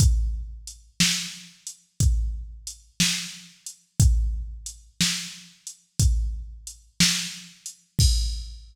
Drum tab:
CC |------------|------------|x-----------|
HH |x-x--xx-x--x|x-x--xx-x--x|------------|
SD |---o-----o--|---o-----o--|------------|
BD |o-----o-----|o-----o-----|o-----------|